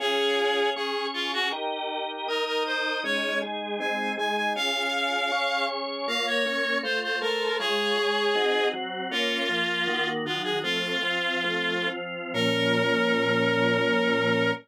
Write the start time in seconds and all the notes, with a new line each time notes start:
0.00 C#4 F4 G#4
0.76 C#4 G#4 C#5
1.14 F4
1.33 F#4
1.52 D#4 G4 A#4
2.28 D#4 A#4 D#5
2.47 A#4
2.66 C5
3.04 G#3 C#4 D#4 C#5
3.42 G#3 D#4 G#4
3.80 G#3 C4 D#4 G#5
4.17 G#3 D#4 G#4 G#5
4.37 G#5
4.56 C#4 F4 G#4 F5
5.32 C#4 G#4 C#5
6.08 A#3 F4 C#5 F5
6.27 C#5
6.45 A#3 C#4 C#5
6.83 A3 F4 C5
7.03 C5
7.21 A3 A4 A#4 C5
7.59 G#3 F4 G#4 C#5
7.97 G#3 G#4 C#5
8.35 C4 D#4 F#4
8.73 F#3 C4 F#4
9.11 A#3 C#4 F4
9.49 F3 A#3 F4
9.87 D#3 A#3 F#4
10.25 D#3 F#3 F4 F#4
10.44 G#4
10.63 F3 A3 C4 F4
11.02 F3 C4 F4
11.44 F3 A3 C4
11.87 F3 C4 F4
12.34 A#2 F3 C#4 A#4